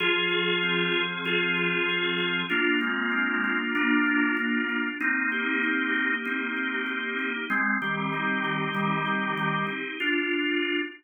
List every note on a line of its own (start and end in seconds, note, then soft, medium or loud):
0.00 1.24 F3 loud
0.00 1.02 F4 loud
0.00 1.02 G#4 loud
0.29 0.91 G#4 medium
0.63 2.18 C4 medium
0.92 1.57 G#4 medium
1.25 2.43 F3 loud
1.25 2.40 F4 medium
1.25 2.40 G#4 loud
1.57 1.89 G#4 medium
1.89 2.49 G#4 medium
2.18 2.48 C4 medium
2.50 4.88 A#3 loud
2.50 2.79 D4 medium
2.50 2.79 F4 loud
2.80 3.58 G#3 medium
2.80 3.58 C4 medium
2.80 3.43 F4 medium
3.11 4.68 D4 medium
3.44 4.06 F4 medium
3.75 4.33 A#3 medium
3.75 4.33 D4 loud
4.07 4.37 F4 medium
4.37 4.63 A#3 medium
4.37 4.63 D4 medium
4.37 4.97 F4 medium
4.69 4.99 D4 medium
5.00 6.25 A#3 loud
5.00 6.13 C4 medium
5.00 6.13 D#4 loud
5.32 5.93 G4 medium
5.63 7.18 D#4 medium
5.93 6.56 G4 medium
6.25 7.44 A#3 medium
6.25 7.30 C4 medium
6.25 7.30 D#4 medium
6.57 6.86 G4 medium
6.86 7.46 G4 medium
7.19 7.48 D#4 medium
7.50 7.76 G#3 loud
7.50 7.76 C4 loud
7.50 8.73 C4 loud
7.82 8.68 D#3 medium
7.82 8.68 G3 medium
7.82 8.43 G4 medium
8.13 9.66 D#4 medium
8.44 9.05 G4 medium
8.74 9.32 D#3 medium
8.74 9.32 G3 loud
8.74 9.92 C4 medium
9.06 9.37 G4 medium
9.37 9.64 D#3 medium
9.37 9.64 G3 loud
9.37 9.97 G4 medium
9.67 9.97 D#4 medium
10.00 10.81 D4 medium
10.00 10.81 F4 medium